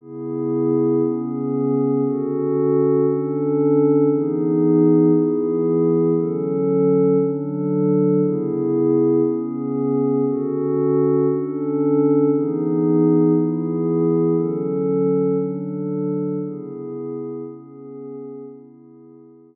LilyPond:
\new Staff { \time 4/4 \key cis \phrygian \tempo 4 = 117 <cis b e' gis'>2 <cis b cis' gis'>2 | <d cis' fis' a'>2 <d cis' d' a'>2 | <e b dis' gis'>2 <e b e' gis'>2 | <d fis cis' a'>2 <d fis d' a'>2 |
<cis b e' gis'>2 <cis b cis' gis'>2 | <d cis' fis' a'>2 <d cis' d' a'>2 | <e b dis' gis'>2 <e b e' gis'>2 | <d fis cis' a'>2 <d fis d' a'>2 |
<cis b e' gis'>2 <cis b cis' gis'>2 | <cis b e' gis'>2 <cis b cis' gis'>2 | }